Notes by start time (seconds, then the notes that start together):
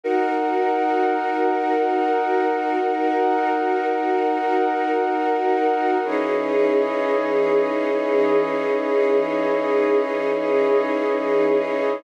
0.04 D#4 F#4 A#4 F#5
6.03 E3 C#4 D#4 E4 G#4 C#5 D#5